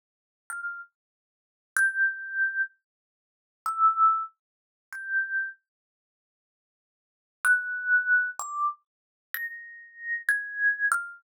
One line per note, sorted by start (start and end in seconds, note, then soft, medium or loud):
0.50 0.78 F6 medium
1.77 2.62 G6 loud
3.66 4.23 E6 medium
4.93 5.49 G6 medium
7.45 8.30 F#6 loud
8.39 8.68 D6 medium
9.34 10.20 A#6 loud
10.29 10.86 G#6 medium
10.92 11.20 F6 loud